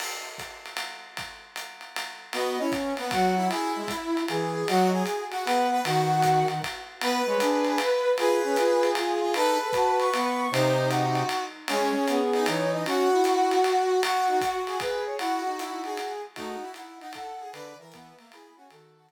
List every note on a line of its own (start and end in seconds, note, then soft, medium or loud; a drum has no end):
0.00 crash medium
0.00 ride medium
0.38 kick soft
0.38 hi-hat pedal medium
0.38 ride medium
0.66 ride medium
0.77 ride medium
1.17 kick soft
1.17 ride medium
1.56 hi-hat pedal medium
1.56 ride medium
1.81 ride medium
1.96 ride medium
2.33 2.57 B3 medium
2.33 2.58 F#4 medium
2.33 2.59 D#5 loud
2.33 ride medium
2.59 2.94 C#4 medium
2.59 2.71 E4 medium
2.72 kick medium
2.72 hi-hat pedal medium
2.72 ride medium
2.97 3.11 B3 medium
2.97 ride medium
3.11 3.48 F#3 medium
3.11 3.35 F#4 medium
3.11 3.48 F#5 loud
3.11 kick medium
3.11 ride medium
3.37 3.49 E4 medium
3.49 4.20 E4 medium
3.49 3.72 G#4 loud
3.49 ride medium
3.76 3.89 G#3 medium
3.88 4.26 E4 medium
3.88 kick medium
3.88 hi-hat pedal medium
3.88 ride medium
4.17 ride medium
4.28 4.64 E3 medium
4.28 4.66 G#4 loud
4.28 ride medium
4.67 5.03 F#3 medium
4.67 4.90 F#4 medium
4.67 4.88 D#5 loud
4.67 ride medium
4.93 5.24 G#4 medium
5.06 hi-hat pedal medium
5.06 ride medium
5.31 5.44 F#4 medium
5.31 ride medium
5.45 5.81 B3 medium
5.45 5.67 B4 medium
5.45 5.79 F#5 loud
5.45 ride medium
5.72 5.82 B4 medium
5.84 6.44 D#3 loud
5.84 6.47 F#4 medium
5.84 6.57 F#5 loud
5.84 ride medium
6.22 kick soft
6.22 hi-hat pedal medium
6.22 ride medium
6.48 6.60 D#3 medium
6.48 ride medium
6.62 kick soft
6.62 ride medium
7.01 7.22 B3 medium
7.01 7.25 B4 loud
7.01 8.10 B4 medium
7.01 ride loud
7.26 7.37 G#3 medium
7.26 7.39 C#5 medium
7.40 7.78 D4 medium
7.40 7.64 G#4 loud
7.40 hi-hat pedal medium
7.40 ride medium
7.65 7.79 G#4 loud
7.65 ride medium
7.78 8.16 B4 loud
7.78 ride medium
8.18 8.41 F4 medium
8.18 9.30 G#4 medium
8.18 8.89 B4 loud
8.18 ride medium
8.44 8.56 C#4 medium
8.56 8.93 F4 medium
8.56 hi-hat pedal medium
8.56 ride medium
8.83 ride medium
8.95 9.20 F4 loud
8.95 ride medium
9.21 9.34 F4 loud
9.34 9.56 D#4 medium
9.34 9.57 A4 loud
9.34 10.42 B4 medium
9.34 ride medium
9.61 9.72 A4 loud
9.73 10.10 F#4 medium
9.73 9.99 A5 loud
9.73 kick medium
9.73 hi-hat pedal medium
9.73 ride medium
9.99 10.50 C#6 loud
9.99 ride medium
10.13 10.48 B3 medium
10.13 ride medium
10.51 11.23 C3 medium
10.51 11.22 D#4 medium
10.51 10.88 C5 loud
10.51 ride loud
10.90 11.43 F#4 loud
10.90 hi-hat pedal medium
10.90 ride medium
11.15 ride medium
11.29 ride medium
11.68 11.92 G#3 medium
11.68 12.19 C#4 medium
11.68 11.90 G#4 loud
11.68 ride loud
11.94 12.05 G#4 loud
12.08 12.46 B3 medium
12.08 12.45 G#4 loud
12.08 hi-hat pedal medium
12.08 ride medium
12.33 12.83 D#4 medium
12.33 ride medium
12.46 12.84 E3 medium
12.46 12.71 C#5 loud
12.46 ride loud
12.73 12.84 D#5 loud
12.86 13.09 C#4 medium
12.86 14.01 F#4 loud
12.86 14.00 F#4 medium
12.86 ride medium
13.12 13.57 E4 medium
13.24 hi-hat pedal medium
13.24 ride medium
13.51 ride medium
13.63 13.87 F#4 medium
13.63 ride medium
14.03 14.27 F#4 medium
14.03 14.27 F#4 loud
14.03 14.59 F#4 medium
14.03 ride loud
14.28 14.39 D#4 medium
14.28 14.39 F#4 loud
14.41 14.77 F#4 medium
14.41 14.78 F#4 loud
14.41 kick medium
14.41 hi-hat pedal medium
14.41 ride medium
14.67 15.15 G#4 medium
14.67 ride medium
14.80 15.03 B4 loud
14.80 kick medium
14.80 ride medium
15.06 15.17 C#5 medium
15.19 15.41 E4 medium
15.19 15.56 F#4 medium
15.19 16.13 F#4 loud
15.19 ride medium
15.46 15.97 D#4 medium
15.59 15.81 E4 medium
15.59 hi-hat pedal medium
15.59 ride medium
15.84 16.22 G#4 medium
15.84 ride medium
15.97 ride medium
16.35 16.57 A3 medium
16.35 16.60 D#4 medium
16.35 16.71 F#4 loud
16.35 kick medium
16.35 ride medium
16.62 16.97 E4 medium
16.74 16.98 F#5 medium
16.74 hi-hat pedal medium
16.74 ride medium
17.00 17.13 D#4 medium
17.00 17.11 F#5 loud
17.00 ride medium
17.13 17.39 A4 medium
17.13 17.50 F#5 loud
17.13 kick soft
17.13 ride loud
17.40 17.53 G#4 medium
17.52 17.74 D3 medium
17.52 17.75 B4 medium
17.52 17.77 D5 loud
17.52 ride medium
17.79 18.13 E3 medium
17.79 17.92 A#4 medium
17.79 18.29 E5 loud
17.92 18.16 B3 medium
17.92 kick medium
17.92 hi-hat pedal medium
17.92 ride medium
18.18 18.31 A#3 medium
18.18 ride medium
18.31 18.56 E4 medium
18.31 18.53 G#4 medium
18.31 18.56 B5 loud
18.31 ride medium
18.56 18.69 C#4 medium
18.56 18.67 F#4 medium
18.56 18.70 G#5 loud
18.70 19.12 D#3 medium
18.70 18.95 F#4 medium
18.70 19.12 A4 loud
18.70 ride medium
18.96 19.12 F#4 medium
19.09 hi-hat pedal medium
19.09 ride medium